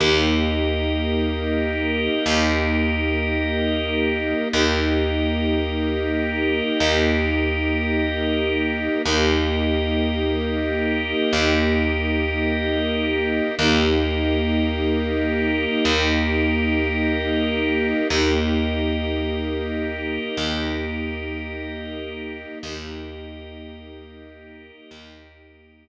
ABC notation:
X:1
M:4/4
L:1/8
Q:1/4=53
K:Eblyd
V:1 name="String Ensemble 1"
[B,EG]8 | [B,EG]8 | [B,EG]8 | [B,EG]8 |
[B,EG]8 | [B,EG]8 |]
V:2 name="Drawbar Organ"
[GBe]8 | [GBe]8 | [GBe]8 | [GBe]8 |
[GBe]8 | [GBe]8 |]
V:3 name="Electric Bass (finger)" clef=bass
E,,4 E,,4 | E,,4 E,,4 | E,,4 E,,4 | E,,4 E,,4 |
E,,4 E,,4 | E,,4 E,,4 |]